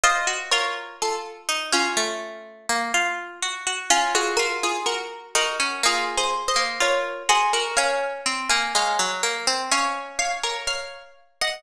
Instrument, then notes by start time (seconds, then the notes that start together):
harpsichord
0.03 F4 C5 D#5
0.27 F#4
0.51 F4 A#4 C#5
1.02 F4 A4
1.49 D#4
1.72 C#4 F4
1.97 A3
2.69 A#3
2.94 F4
3.42 F#4
3.67 F#4
3.90 C#4 F4
4.15 F4 F#4 G#4
4.37 F4 F#4 A#4
4.63 F4 G#4
4.86 F#4 A#4
5.35 D#4 F#4 A#4
5.60 C#4
5.83 A#3 F4 G#4
6.17 G#4 C5
6.48 C5 D#5
6.56 A#3
6.80 F4 A#4 C#5
7.29 F#4 G#4 C5
7.53 F#4 A#4
7.77 C#4 C#5 F5
8.26 C4
8.49 A#3 F5 G#5
8.75 G#3 C#5 F5
8.99 F#3
9.23 A#3
9.47 C4
9.71 C#4 C#5 F5
10.19 C#5 F5
10.43 A#4 C#5
10.67 C#5 F5
11.41 D#5 F#5